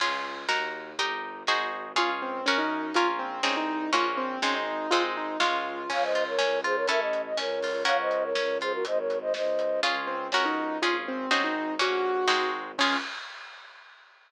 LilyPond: <<
  \new Staff \with { instrumentName = "Acoustic Grand Piano" } { \time 2/4 \key des \major \tempo 4 = 122 r2 | r2 | f'16 r16 c'8 des'16 ees'8. | f'16 r16 c'8 des'16 ees'8. |
f'16 r16 c'8 des'16 ees'8. | f'16 r16 ees'8 f'4 | r2 | r2 |
r2 | r2 | f'16 r16 c'8 des'16 ees'8. | f'16 r16 c'8 des'16 ees'8. |
ges'4. r8 | des'4 r4 | }
  \new Staff \with { instrumentName = "Flute" } { \time 2/4 \key des \major r2 | r2 | r2 | r2 |
r2 | r2 | <des'' f''>16 <c'' ees''>8 <bes' des''>8. <aes' c''>16 <bes' des''>16 | <bes' e''>16 ees''8 ees''16 <bes' des''>4 |
<des'' f''>16 <c'' ees''>8 <bes' des''>8. <aes' c''>16 <ges' bes'>16 | <c'' ees''>16 <bes' des''>8 <c'' ees''>16 <c'' ees''>4 | r2 | r2 |
r2 | r2 | }
  \new Staff \with { instrumentName = "Orchestral Harp" } { \time 2/4 \key des \major <des' f' aes'>4 <ees' ges' bes'>4 | <ees' g' bes'>4 <ees' ges' aes' c''>4 | <des' f' aes'>4 <des' ges' bes'>4 | <des' f' bes'>4 <c' ees' aes'>4 |
<bes des' ges'>4 <aes c' ees'>4 | <aes c' ees'>4 <aes des' f'>4 | des'8 f'8 des'8 f'8 | <cis' e' a'>4 des'8 f'8 |
<des' ges' bes'>4 des'8 f'8 | r2 | <des' f' aes'>4 <des' ges' bes'>4 | <des' f' aes'>4 <c' ees' ges' aes'>4 |
<bes des' ges'>4 <aes c' ees' ges'>4 | <des' f' aes'>4 r4 | }
  \new Staff \with { instrumentName = "Violin" } { \clef bass \time 2/4 \key des \major des,4 ees,4 | g,,4 aes,,4 | des,4 ges,4 | bes,,4 c,4 |
bes,,4 aes,,4 | aes,,4 des,4 | des,4 des,4 | a,,4 des,4 |
des,4 des,4 | aes,,4 des,4 | des,4 des,4 | aes,,4 aes,,4 |
bes,,4 aes,,4 | des,4 r4 | }
  \new DrumStaff \with { instrumentName = "Drums" } \drummode { \time 2/4 <cymc bd>4 sn4 | <hh bd>4 sn4 | <hh bd>4 sn4 | <hh bd>4 sn4 |
<hh bd>4 sn4 | <hh bd>4 sn4 | <cymc bd>8 hh8 sn8 hh8 | <hh bd>8 hh8 sn8 hho8 |
<hh bd>8 hh8 sn8 hh8 | <hh bd>8 hh8 sn8 hh8 | <hh bd>4 sn4 | <hh bd>4 sn4 |
<hh bd>4 sn4 | <cymc bd>4 r4 | }
>>